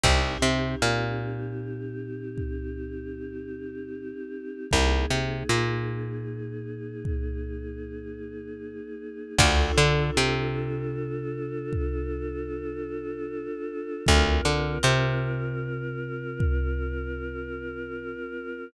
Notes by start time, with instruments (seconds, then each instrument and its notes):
0.03 electric bass (finger) C2, pizzicato strings C4 D#4 G4, choir aahs C4 D#4 G4, kick, crash
0.42 electric bass (finger) C3, pizzicato strings C4
0.82 electric bass (finger) A#2, pizzicato strings A#3
2.38 kick
4.71 electric bass (finger) C2, choir aahs A#3 D#4 G#4, kick
5.10 electric bass (finger) C3, pizzicato strings C4
5.49 electric bass (finger) A#2, pizzicato strings A#3
7.05 kick
9.38 electric bass (finger) D2, choir aahs D4 F4 A4, pizzicato strings D4 F4 A4, kick, crash
9.77 electric bass (finger) D3, pizzicato strings D4
10.17 electric bass (finger) C3, pizzicato strings C4
11.73 kick
14.05 electric bass (finger) D2, choir aahs C4 F4 A#4, kick
14.45 electric bass (finger) D3, pizzicato strings D4
14.83 electric bass (finger) C3, pizzicato strings C4
16.40 kick